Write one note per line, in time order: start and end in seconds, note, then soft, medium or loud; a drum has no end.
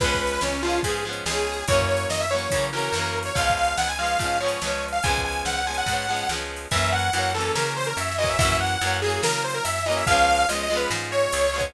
0.00 0.38 C#2 medium
0.00 0.58 F3 loud
0.00 0.58 G#3 loud
0.00 0.58 B3 loud
0.00 0.41 B4 medium
0.00 kick loud
0.00 crash medium
0.06 0.58 C#4 loud
0.14 kick medium
0.27 ride medium
0.41 0.80 C#2 medium
0.41 0.62 C#4 medium
0.41 snare medium
0.62 0.82 F3 medium
0.62 0.82 G#3 medium
0.62 0.80 F4 medium
0.67 0.82 B3 medium
0.67 0.82 C#4 medium
0.67 ride medium
0.83 1.22 G#2 medium
0.83 1.03 F3 medium
0.83 1.03 G#3 medium
0.83 1.04 G#4 medium
0.83 kick medium
0.83 ride loud
0.88 1.03 B3 medium
0.88 1.03 C#4 loud
1.05 1.24 F3 medium
1.05 1.24 G#3 medium
1.05 1.24 B3 medium
1.11 1.24 C#4 medium
1.11 ride medium
1.26 1.63 C#2 medium
1.26 1.64 F3 medium
1.26 1.64 G#3 medium
1.26 1.65 G#4 medium
1.26 snare loud
1.30 1.64 B3 medium
1.30 1.64 C#4 medium
1.53 ride medium
1.68 2.06 F#2 medium
1.68 2.26 E3 loud
1.68 2.26 F#3 medium
1.68 1.85 C#5 medium
1.68 kick loud
1.68 ride loud
1.72 2.26 A#3 loud
1.72 2.26 C#4 loud
1.81 kick medium
1.89 2.06 C#5 medium
1.97 ride medium
2.10 2.47 F#2 medium
2.10 2.20 D#5 medium
2.10 snare medium
2.20 2.30 E5 medium
2.31 2.50 E3 medium
2.31 2.50 F#3 medium
2.31 2.66 C#5 medium
2.35 2.50 A#3 medium
2.35 2.50 C#4 medium
2.35 ride medium
2.51 2.89 C#3 medium
2.51 2.71 E3 medium
2.51 2.71 F#3 medium
2.51 kick medium
2.51 ride loud
2.56 2.71 A#3 medium
2.56 2.71 C#4 medium
2.73 2.92 E3 medium
2.73 2.92 F#3 medium
2.73 2.92 A#3 medium
2.73 3.19 A#4 medium
2.78 2.92 C#4 medium
2.78 ride medium
2.92 3.30 F#2 medium
2.92 3.32 E3 loud
2.92 3.32 F#3 loud
2.92 snare medium
2.98 3.32 A#3 loud
2.98 3.32 C#4 loud
3.23 3.35 C#5 medium
3.23 ride medium
3.35 3.74 C#2 medium
3.35 3.93 F3 medium
3.35 3.93 G#3 medium
3.35 3.55 F5 medium
3.35 kick medium
3.35 ride medium
3.39 3.93 B3 loud
3.39 3.93 C#4 loud
3.49 kick medium
3.49 ride medium
3.57 3.76 F5 medium
3.64 ride medium
3.78 4.16 C#2 medium
3.78 3.88 F#5 medium
3.78 snare medium
3.88 3.98 G#5 medium
3.99 4.18 F3 medium
3.99 4.18 G#3 medium
3.99 4.18 B3 medium
3.99 4.38 F5 medium
4.04 4.18 C#4 medium
4.04 ride medium
4.19 4.57 G#2 medium
4.19 4.39 F3 medium
4.19 4.39 G#3 medium
4.19 kick medium
4.19 ride medium
4.23 4.39 B3 medium
4.23 4.39 C#4 medium
4.40 4.60 F3 medium
4.40 4.60 G#3 medium
4.40 4.60 B3 medium
4.40 4.85 C#5 medium
4.46 4.60 C#4 loud
4.46 ride medium
4.62 5.00 C#2 medium
4.62 5.00 F3 medium
4.62 5.00 G#3 loud
4.62 5.00 B3 medium
4.62 snare medium
4.67 5.00 C#4 medium
4.88 ride medium
4.92 5.02 F5 medium
5.03 5.42 C#2 medium
5.03 5.62 F3 loud
5.03 5.62 G#3 loud
5.03 5.21 G#5 medium
5.03 kick medium
5.03 ride medium
5.07 5.62 B3 medium
5.07 5.62 C#4 loud
5.17 kick medium
5.25 5.42 G#5 medium
5.32 ride medium
5.45 5.83 C#2 medium
5.45 5.56 F#5 medium
5.45 snare medium
5.56 5.66 F#5 medium
5.66 5.86 F3 medium
5.66 5.86 G#3 medium
5.66 5.86 B3 medium
5.66 5.77 G#5 medium
5.72 5.86 C#4 medium
5.72 ride medium
5.78 6.29 F#5 medium
5.86 6.24 G#2 medium
5.86 6.07 F3 medium
5.86 6.07 G#3 medium
5.86 kick medium
5.86 ride medium
5.91 6.07 B3 medium
5.91 6.07 C#4 medium
6.08 6.28 F3 medium
6.08 6.28 G#3 medium
6.08 6.28 B3 medium
6.14 6.28 C#4 medium
6.14 ride medium
6.29 6.67 C#2 medium
6.29 6.68 F3 medium
6.29 6.68 G#3 medium
6.29 snare medium
6.33 6.68 B3 medium
6.33 6.68 C#4 medium
6.56 ride medium
6.71 7.09 F#2 medium
6.71 7.10 E3 loud
6.71 7.10 F#3 loud
6.71 6.90 E5 medium
6.71 kick medium
6.71 ride medium
6.75 7.10 A#3 loud
6.75 7.10 C#4 loud
6.92 7.31 F#5 medium
6.99 ride medium
7.13 7.51 F#2 medium
7.13 7.33 E3 loud
7.13 7.33 F#3 loud
7.13 ride medium
7.17 7.33 A#3 loud
7.17 7.33 C#4 loud
7.34 8.12 E3 medium
7.34 8.12 F#3 loud
7.34 8.12 A#3 loud
7.34 7.52 A4 medium
7.40 8.12 C#4 loud
7.40 ride medium
7.55 7.93 C#3 medium
7.55 7.73 A#4 medium
7.55 snare loud
7.76 7.86 C5 medium
7.84 7.97 A#4 medium
7.84 ride medium
7.97 8.35 F#2 medium
7.97 8.15 E5 medium
7.97 ride medium
8.12 snare medium
8.18 8.37 E3 loud
8.18 8.37 F#3 medium
8.18 8.37 A#3 medium
8.18 8.28 D#5 medium
8.24 8.37 C#4 medium
8.24 kick medium
8.24 ride medium
8.29 8.38 E5 medium
8.39 8.76 F#2 medium
8.39 8.78 E3 loud
8.39 8.78 F#3 loud
8.39 8.57 E5 loud
8.39 kick loud
8.39 ride loud
8.43 8.78 A#3 loud
8.43 8.78 C#4 loud
8.52 kick medium
8.60 8.98 F#5 medium
8.67 ride medium
8.81 9.19 F#2 medium
8.81 9.00 E3 medium
8.81 9.00 F#3 loud
8.81 9.00 A#3 medium
8.81 ride medium
8.87 9.00 C#4 loud
9.02 9.79 E3 loud
9.02 9.79 F#3 medium
9.02 9.21 G#4 medium
9.06 9.79 A#3 loud
9.06 9.79 C#4 medium
9.06 ride medium
9.23 9.60 C#3 medium
9.23 9.42 A#4 medium
9.23 snare loud
9.44 9.54 C5 medium
9.50 ride medium
9.54 9.64 A#4 medium
9.64 10.03 F#2 medium
9.64 9.83 E5 medium
9.64 ride loud
9.78 snare medium
9.86 10.05 E3 loud
9.86 10.05 F#3 loud
9.86 10.05 A#3 loud
9.86 9.96 D#5 medium
9.92 10.05 C#4 loud
9.92 ride medium
9.97 10.07 E5 medium
10.07 10.45 C#2 medium
10.07 10.46 F3 loud
10.07 10.46 G#3 loud
10.07 10.47 F5 loud
10.07 kick loud
10.07 ride medium
10.11 10.46 B3 loud
10.11 10.46 C#4 loud
10.35 ride medium
10.49 10.86 C#2 medium
10.49 10.68 F3 medium
10.49 10.68 G#3 medium
10.49 10.62 D#5 medium
10.49 ride loud
10.53 10.68 B3 medium
10.53 10.68 C#4 medium
10.63 10.76 D#5 medium
10.70 11.47 F3 loud
10.70 11.47 G#3 loud
10.70 11.47 B3 medium
10.76 11.47 C#4 loud
10.76 10.90 B4 medium
10.76 ride medium
10.90 11.28 G#2 medium
10.90 snare medium
11.12 11.65 C#5 medium
11.19 ride medium
11.32 11.71 C#2 medium
11.32 ride loud
11.46 snare soft
11.54 11.73 F3 medium
11.54 11.73 G#3 medium
11.54 11.73 B3 medium
11.60 11.73 C#4 loud
11.60 kick medium
11.60 ride medium